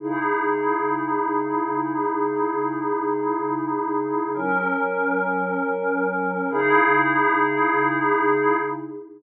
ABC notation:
X:1
M:3/4
L:1/8
Q:1/4=83
K:C#dor
V:1 name="Pad 5 (bowed)"
[C,DEG]6- | [C,DEG]6 | [F,CA]6 | [C,DEG]6 |]